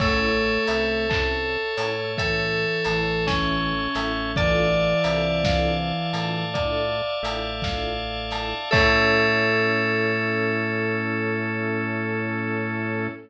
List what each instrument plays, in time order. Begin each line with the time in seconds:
0.00 drawbar organ A1 C#5 E5 A5, flute A3, string ensemble 1 E4 A4, electric piano 2 A4, tubular bells C#5, kick, crash
0.05 string ensemble 1 C#4
0.67 drawbar organ C2, string ensemble 1 E4 A4, tubular bells E5, open hi-hat
0.72 string ensemble 1 C#4
1.09 string ensemble 1 C#4 E4 A4, tubular bells A5, kick, clap
1.77 drawbar organ A2, string ensemble 1 C#4 E4 A4, tubular bells C#5, open hi-hat
2.17 flute E3, string ensemble 1 E4 A4, electric piano 2 A4, tubular bells E5, kick, closed hi-hat
2.22 string ensemble 1 C#4
2.84 drawbar organ A1, flute E3, string ensemble 1 A4, tubular bells A5, snare, open hi-hat
2.88 string ensemble 1 C#4 E4
3.27 electric piano 2 C#4, string ensemble 1 E4 A4, tubular bells C#5, kick, snare
3.32 string ensemble 1 C#4
3.95 drawbar organ A1, string ensemble 1 C#4 E4 A4, tubular bells E5, snare, open hi-hat
4.36 flute E3, string ensemble 1 F4 A4, tubular bells D5, electric piano 2 D5, drawbar organ D5 E5 F5 A5, kick, closed hi-hat
4.40 string ensemble 1 D4 E4
5.04 drawbar organ C2, string ensemble 1 F4 A4, tubular bells E5, open hi-hat
5.08 string ensemble 1 D4 E4
5.44 string ensemble 1 F4 A4, tubular bells F5, kick, snare
5.49 string ensemble 1 D4 E4
6.13 drawbar organ A2, string ensemble 1 F4 A4, tubular bells A5, open hi-hat
6.18 string ensemble 1 D4 E4
6.54 string ensemble 1 F4 A4, tubular bells D5, kick, closed hi-hat
6.58 string ensemble 1 D4 E4
7.23 drawbar organ A1, string ensemble 1 F4 A4, tubular bells E5, open hi-hat
7.27 string ensemble 1 D4 E4
7.62 string ensemble 1 A4, tubular bells F5, kick, snare
7.67 string ensemble 1 D4 E4 F4
8.31 string ensemble 1 F4 A4, tubular bells A5, snare, open hi-hat
8.36 string ensemble 1 D4 E4
8.71 drawbar organ A2 C#4 E4 A4, flute A3, electric piano 2 A4, string ensemble 1 A4, tubular bells C#5 E5 A5, kick, crash
8.75 string ensemble 1 C#4 E4